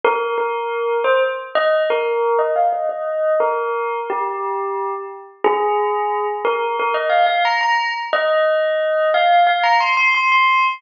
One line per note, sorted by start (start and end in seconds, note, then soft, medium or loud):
0.04 0.36 A#4 medium
0.38 0.97 A#4 medium
1.04 1.20 C5 medium
1.55 1.83 D#5 medium
1.90 2.40 A#4 medium
2.39 2.55 D#5 medium
2.56 2.72 F5 medium
2.72 2.88 D#5 medium
2.89 3.33 D#5 medium
3.40 4.00 A#4 medium
4.10 4.94 G4 medium
5.44 6.27 G#4 loud
6.45 6.76 A#4 medium
6.79 6.96 A#4 medium
6.94 7.10 D#5 medium
7.10 7.26 F5 medium
7.26 7.42 F5 medium
7.45 7.61 A#5 medium
7.61 7.90 A#5 medium
8.13 9.10 D#5 medium
9.14 9.43 F5 medium
9.47 9.63 F5 medium
9.63 9.79 A#5 medium
9.80 9.96 C6 medium
9.97 10.13 C6 medium
10.15 10.31 C6 medium
10.32 10.65 C6 medium